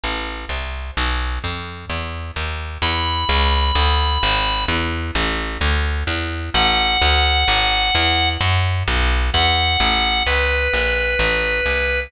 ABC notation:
X:1
M:4/4
L:1/8
Q:1/4=129
K:A
V:1 name="Drawbar Organ"
z4 | z8 | b8 | z8 |
f8 | z4 f4 | B8 |]
V:2 name="Electric Bass (finger)" clef=bass
A,,,2 =C,,2 | B,,,2 =F,,2 E,,2 ^D,,2 | E,,2 C,,2 D,,2 G,,,2 | E,,2 A,,,2 D,,2 E,,2 |
A,,,2 D,,2 G,,,2 E,,2 | F,,2 B,,,2 E,,2 A,,,2 | C,,2 ^A,,,2 =A,,,2 =C,,2 |]